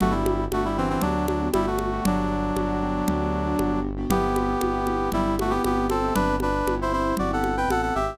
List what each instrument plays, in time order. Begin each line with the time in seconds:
0.00 synth bass 1 G1, brass section A3 F#4, acoustic grand piano B3 D4 F#4 G4, low conga
0.11 brass section G3 E4
0.26 high conga
0.51 synth bass 1 G1, brass section A3 F#4, acoustic grand piano B3 D4 F#4 G4, high conga
0.65 brass section G3 E4
0.77 brass section E3 C4, acoustic grand piano B3 D4 F#4 G4
0.90 brass section E3 C4
1.01 synth bass 1 D2, brass section F#3 D4, acoustic grand piano B3 D4 F#4 G4, low conga
1.15 acoustic grand piano B3 D4 F#4 G4
1.28 brass section F#3 D4, high conga
1.41 acoustic grand piano B3 D4 F#4 G4
1.54 synth bass 1 G1, brass section G3 E4, high conga
1.67 brass section A3 F#4
1.79 high conga
1.92 acoustic grand piano B3 D4 F#4 G4
2.05 synth bass 1 G1, brass section F#3 D4, low conga
2.56 synth bass 1 G1, acoustic grand piano B3 D4 F#4 G4, high conga
2.82 acoustic grand piano B3 D4 F#4 G4
3.08 synth bass 1 D2, acoustic grand piano B3 D4 F#4 G4, low conga
3.20 acoustic grand piano B3 D4 F#4 G4
3.46 acoustic grand piano B3 D4 F#4 G4
3.59 synth bass 1 G1, high conga
3.97 acoustic grand piano B3 D4 F#4 G4
4.10 synth bass 1 G1, acoustic grand piano B3 C4 E4 G4, brass section B3 G4, low conga
4.36 high conga
4.61 synth bass 1 G1, acoustic grand piano B3 C4 E4 G4, high conga
4.87 acoustic grand piano B3 C4 E4 G4, high conga
5.12 synth bass 1 G1, brass section G3 E4, acoustic grand piano B3 C4 E4 G4, low conga
5.26 acoustic grand piano B3 C4 E4 G4
5.39 brass section A3 F#4, high conga
5.50 brass section B3 G4, acoustic grand piano B3 C4 E4 G4
5.64 synth bass 1 G1, brass section B3 G4, high conga
5.90 brass section C4 A4, high conga
6.03 acoustic grand piano B3 C4 E4 G4
6.15 synth bass 1 G1, brass section D4 B4, low conga
6.40 brass section D4 B4, high conga
6.66 synth bass 1 G1, acoustic grand piano B3 C4 E4 G4, high conga
6.82 brass section E4 C5
6.92 acoustic grand piano B3 C4 E4 G4, brass section E4 C5
7.17 synth bass 1 G1, acoustic grand piano B3 C4 E4 G4, brass section F#4 D5, low conga
7.31 acoustic grand piano B3 C4 E4 G4, brass section A4 F#5
7.44 high conga
7.56 acoustic grand piano B3 C4 E4 G4, brass section B4 G5
7.68 synth bass 1 A1, brass section A4 F#5, high conga
7.82 brass section A4 F#5
7.95 synth bass 1 G#1, brass section G4 E5
8.08 acoustic grand piano B3 C4 E4 G4